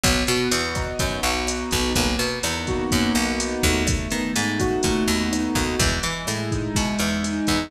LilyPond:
<<
  \new Staff \with { instrumentName = "Acoustic Grand Piano" } { \time 4/4 \key b \major \tempo 4 = 125 b8 fis'8 b8 dis'8 b8 fis'8 dis'8 b8 | ais8 b8 dis'8 fis'8 ais8 b8 dis'8 a8~ | a8 b8 dis'8 fis'8 a8 b8 dis'8 fis'8 | gis8 e'8 gis8 dis'8 gis8 e'8 dis'8 gis8 | }
  \new Staff \with { instrumentName = "Electric Bass (finger)" } { \clef bass \time 4/4 \key b \major b,,8 b,8 e,4 fis,8 b,,4 b,,8 | b,,8 b,8 e,4 fis,8 b,,4 dis,8~ | dis,8 dis8 gis,4 ais,8 dis,4 dis,8 | e,8 e8 a,4 b,8 e,4 e,8 | }
  \new DrumStaff \with { instrumentName = "Drums" } \drummode { \time 4/4 <hh bd ss>8 hh8 hh8 <hh bd ss>8 <hh bd>8 hh8 <hh ss>8 <hh bd>8 | <hh bd>8 hh8 <hh ss>8 <hh bd>8 <hh bd>8 <hh ss>8 hh8 <hh bd>8 | <hh bd ss>8 hh8 hh8 <hh bd ss>8 <hh bd>8 hh8 <hh ss>8 <hh bd ss>8 | <hh bd>8 hh8 <hh ss>8 <hh bd>8 <hh bd>8 <hh ss>8 hh8 <hh bd>8 | }
>>